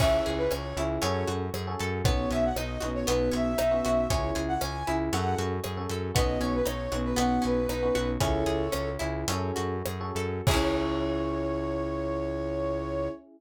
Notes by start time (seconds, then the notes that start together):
0.00 C#2 C#4 E4 G#4 E5, kick, crash
0.26 C#2 G#4, closed hi-hat
0.38 B4
0.51 C#2 C#4 C#5, cross-stick
0.77 C#2 C#4 E4 G#4, closed hi-hat
1.02 F#2 C#4 F#4 G#4 A4 C#5, closed hi-hat
1.27 F#2 F#4, closed hi-hat
1.54 F#2 G#4, cross-stick
1.67 C#4 F#4 G#4 A4
1.79 F#2 A4, closed hi-hat
2.04 B1 B3 C#4 D#4 F#4 C#5, kick, closed hi-hat
2.31 B1 C#4 E5, closed hi-hat
2.44 F#5
2.56 B1 D#4 D#5, cross-stick
2.80 B1 B3 C#4 D#4 F#4, closed hi-hat
2.95 C#5
3.07 B1 B3 C#4 D#4 F#4 B4, closed hi-hat
3.32 B1 C#4 E5, closed hi-hat
3.58 B1 D#4, cross-stick
3.71 B3 C#4 D#4 F#4
3.85 B1 F#4, closed hi-hat
4.10 C#2 C#4 E4 G#4 C#5, kick, closed hi-hat
4.35 C#2 G#4, closed hi-hat
4.48 F#5
4.61 C#2 C#4 G#5, cross-stick
4.87 C#2 C#4 E4 G#4, closed hi-hat
5.13 F#2 C#4 F#4 G#4 A4 F#5, closed hi-hat
5.38 F#2 F#4, closed hi-hat
5.64 F#2 G#4, cross-stick
5.77 C#4 F#4 G#4 A4
5.90 F#2 A4, closed hi-hat
6.15 B1 B3 C#4 D#4 F#4 D#5, kick, closed hi-hat
6.40 B1 C#4 C#5, closed hi-hat
6.54 B4
6.65 B1 D#4 C#5, cross-stick
6.92 B1 B3 C#4 D#4 F#4, closed hi-hat
7.04 B4
7.16 B1 B3 C#4 D#4 F#4 F#5, closed hi-hat
7.42 B1 C#4 B4, closed hi-hat
7.69 B1 D#4, cross-stick
7.83 B3 C#4 D#4 F#4
7.95 B1 F#4, closed hi-hat
8.20 C#2 C#4 E4 G#4 A4 C#5, kick, closed hi-hat
8.46 C#2 G#4, closed hi-hat
8.72 C#2 C#4, cross-stick
8.99 C#2 C#4 E4 G#4, closed hi-hat
9.28 F#2 C#4 F#4 G#4 A4, closed hi-hat
9.56 F#2 F#4, closed hi-hat
9.86 F#2 G#4, cross-stick
10.01 C#4 F#4 G#4 A4
10.15 F#2 A4, closed hi-hat
10.47 C#2 C#4 E4 G#4 C#5, kick, crash
10.51 C#4 E4